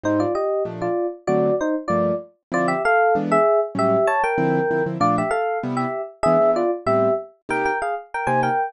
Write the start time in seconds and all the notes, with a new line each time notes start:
0.03 G#2 G3 C4 D#4 C5
0.20 F4 D5
0.35 G4 D#5
0.65 A#2 F3 A3 D4
0.82 F4 D5
1.27 D3 F#3 A3 C4 F#4 D5
1.61 D#4 C5
1.88 G2 F3 A3 A#3 F4 D5
2.52 D3 F3 C4 E4 F4 D5
2.68 G4 E5
2.85 A4 F5
3.15 E3 G#3 B3 D4
3.32 G#4 E5
3.75 A2 F#3 G3 C#4 G4 E5
4.07 C#5 A5
4.24 A#4 G5
4.38 D3 F3 C4 E4
4.71 D3 F3 C4 E4
4.86 D3 F3 C4 E4
5.00 A#2 F3 A3 D4 F4 D5
5.18 G4 E5
5.31 A4 F5
5.63 C3 G3 B3 E4
5.77 G4 E5
6.23 E3 G#3 B3 D4 G#4 E5
6.41 E3 G#3 B3 D4
6.56 F4 D5
6.86 A2 G3 B3 C4 G4 E5
7.49 C3 A#3 D#4 G4 A#4 G5
7.65 A#4 G5
7.82 G#4 F5
8.14 A#4 G5
8.27 C3 A#3 D#4 G4 C5 G#5
8.43 A#4 G5